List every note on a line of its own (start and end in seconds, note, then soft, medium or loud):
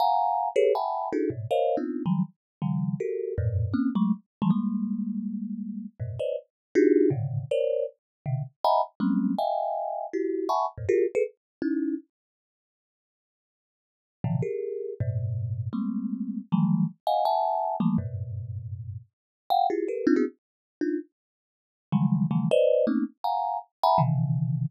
0.00 0.49 F5 medium
0.00 0.49 F#5 medium
0.00 0.49 G#5 medium
0.00 0.49 A#5 medium
0.56 0.73 G4 loud
0.56 0.73 G#4 loud
0.56 0.73 A4 loud
0.56 0.73 B4 loud
0.56 0.73 C#5 loud
0.75 1.09 E5 medium
0.75 1.09 F#5 medium
0.75 1.09 G5 medium
0.75 1.09 G#5 medium
0.75 1.09 A5 medium
0.75 1.09 B5 medium
1.13 1.29 D4 medium
1.13 1.29 D#4 medium
1.13 1.29 E4 medium
1.13 1.29 F#4 medium
1.13 1.29 G#4 medium
1.13 1.29 A4 medium
1.30 1.47 G#2 medium
1.30 1.47 A2 medium
1.30 1.47 B2 medium
1.51 1.76 A#4 medium
1.51 1.76 C5 medium
1.51 1.76 C#5 medium
1.51 1.76 D#5 medium
1.51 1.76 F5 medium
1.77 2.02 B3 medium
1.77 2.02 C4 medium
1.77 2.02 D4 medium
1.77 2.02 D#4 medium
1.77 2.02 F4 medium
2.06 2.23 D#3 medium
2.06 2.23 F3 medium
2.06 2.23 F#3 medium
2.06 2.23 G3 medium
2.62 2.96 C#3 medium
2.62 2.96 D#3 medium
2.62 2.96 F3 medium
2.62 2.96 G3 medium
3.00 3.34 F#4 medium
3.00 3.34 G4 medium
3.00 3.34 A4 medium
3.00 3.34 A#4 medium
3.38 3.72 F2 loud
3.38 3.72 F#2 loud
3.38 3.72 G2 loud
3.38 3.72 A2 loud
3.38 3.72 A#2 loud
3.74 3.90 A#3 medium
3.74 3.90 C4 medium
3.74 3.90 C#4 medium
3.95 4.12 F#3 loud
3.95 4.12 G#3 loud
3.95 4.12 A3 loud
4.42 4.50 E3 loud
4.42 4.50 F3 loud
4.42 4.50 G3 loud
4.42 4.50 G#3 loud
4.50 5.85 G3 medium
4.50 5.85 G#3 medium
4.50 5.85 A#3 medium
6.00 6.16 F#2 medium
6.00 6.16 G#2 medium
6.00 6.16 A#2 medium
6.00 6.16 B2 medium
6.19 6.36 B4 medium
6.19 6.36 C5 medium
6.19 6.36 C#5 medium
6.19 6.36 D5 medium
6.19 6.36 D#5 medium
6.75 7.09 D4 loud
6.75 7.09 D#4 loud
6.75 7.09 F4 loud
6.75 7.09 F#4 loud
6.75 7.09 G4 loud
6.75 7.09 G#4 loud
7.10 7.44 G#2 medium
7.10 7.44 A2 medium
7.10 7.44 A#2 medium
7.10 7.44 C3 medium
7.10 7.44 C#3 medium
7.10 7.44 D3 medium
7.51 7.85 A#4 medium
7.51 7.85 C5 medium
7.51 7.85 C#5 medium
7.51 7.85 D5 medium
8.26 8.43 B2 medium
8.26 8.43 C3 medium
8.26 8.43 D3 medium
8.64 8.81 D#5 medium
8.64 8.81 E5 medium
8.64 8.81 F#5 medium
8.64 8.81 G#5 medium
8.64 8.81 A#5 medium
8.64 8.81 B5 medium
9.00 9.34 F#3 medium
9.00 9.34 G3 medium
9.00 9.34 G#3 medium
9.00 9.34 A#3 medium
9.00 9.34 C4 medium
9.00 9.34 C#4 medium
9.38 10.06 D#5 medium
9.38 10.06 E5 medium
9.38 10.06 F5 medium
9.38 10.06 G5 medium
9.38 10.06 G#5 medium
10.13 10.47 E4 medium
10.13 10.47 F#4 medium
10.13 10.47 G4 medium
10.49 10.66 E5 medium
10.49 10.66 F#5 medium
10.49 10.66 G#5 medium
10.49 10.66 A5 medium
10.49 10.66 B5 medium
10.49 10.66 C#6 medium
10.78 10.86 F2 medium
10.78 10.86 G2 medium
10.78 10.86 G#2 medium
10.78 10.86 A#2 medium
10.89 11.06 F4 medium
10.89 11.06 F#4 medium
10.89 11.06 G4 medium
10.89 11.06 G#4 medium
10.89 11.06 A#4 medium
11.15 11.23 G#4 loud
11.15 11.23 A4 loud
11.15 11.23 B4 loud
11.62 11.96 C#4 medium
11.62 11.96 D#4 medium
11.62 11.96 E4 medium
14.24 14.41 A2 medium
14.24 14.41 B2 medium
14.24 14.41 C3 medium
14.24 14.41 D3 medium
14.24 14.41 E3 medium
14.24 14.41 F3 medium
14.42 14.93 G4 medium
14.42 14.93 G#4 medium
14.42 14.93 A#4 medium
15.00 15.68 G2 medium
15.00 15.68 A2 medium
15.00 15.68 B2 medium
15.73 16.40 G3 medium
15.73 16.40 G#3 medium
15.73 16.40 A3 medium
15.73 16.40 A#3 medium
15.73 16.40 C4 medium
16.52 16.86 D#3 medium
16.52 16.86 E3 medium
16.52 16.86 F3 medium
16.52 16.86 F#3 medium
16.52 16.86 G3 medium
16.52 16.86 A3 medium
17.07 17.24 D#5 medium
17.07 17.24 F5 medium
17.07 17.24 F#5 medium
17.07 17.24 G#5 medium
17.25 17.76 E5 medium
17.25 17.76 F#5 medium
17.25 17.76 G#5 medium
17.25 17.76 A5 medium
17.80 17.97 E3 medium
17.80 17.97 F3 medium
17.80 17.97 G3 medium
17.80 17.97 A3 medium
17.80 17.97 A#3 medium
17.98 19.00 F#2 medium
17.98 19.00 G2 medium
17.98 19.00 A2 medium
17.98 19.00 B2 medium
19.50 19.67 F5 loud
19.50 19.67 F#5 loud
19.50 19.67 G5 loud
19.70 19.87 E4 medium
19.70 19.87 F4 medium
19.70 19.87 G4 medium
19.70 19.87 G#4 medium
19.88 20.05 G4 medium
19.88 20.05 A4 medium
19.88 20.05 A#4 medium
19.88 20.05 B4 medium
20.07 20.15 C4 loud
20.07 20.15 D4 loud
20.07 20.15 D#4 loud
20.07 20.15 F4 loud
20.16 20.25 B3 medium
20.16 20.25 C4 medium
20.16 20.25 D4 medium
20.16 20.25 E4 medium
20.16 20.25 F#4 medium
20.16 20.25 G#4 medium
20.81 20.98 D4 medium
20.81 20.98 D#4 medium
20.81 20.98 F4 medium
21.92 22.26 C#3 medium
21.92 22.26 D#3 medium
21.92 22.26 E3 medium
21.92 22.26 F#3 medium
21.92 22.26 G3 medium
21.92 22.26 G#3 medium
22.31 22.48 C#3 medium
22.31 22.48 D#3 medium
22.31 22.48 E3 medium
22.31 22.48 F3 medium
22.31 22.48 G3 medium
22.31 22.48 A3 medium
22.51 22.85 B4 loud
22.51 22.85 C5 loud
22.51 22.85 D5 loud
22.51 22.85 D#5 loud
22.87 23.04 A3 medium
22.87 23.04 A#3 medium
22.87 23.04 C4 medium
22.87 23.04 C#4 medium
22.87 23.04 D#4 medium
23.24 23.58 F5 medium
23.24 23.58 F#5 medium
23.24 23.58 G#5 medium
23.24 23.58 A#5 medium
23.83 24.00 E5 loud
23.83 24.00 F#5 loud
23.83 24.00 G#5 loud
23.83 24.00 A#5 loud
23.83 24.00 B5 loud
23.98 24.66 B2 medium
23.98 24.66 C3 medium
23.98 24.66 C#3 medium
23.98 24.66 D#3 medium
23.98 24.66 E3 medium